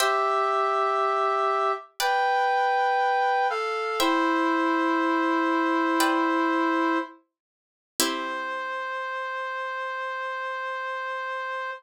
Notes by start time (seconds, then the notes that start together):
0.00 G4 C5 E5 G5
2.00 B4 D5 G5
3.50 A4 F5
4.00 E4 C5 E5 G5
6.00 B4 D5 G5
8.00 C4 E4 G4 C5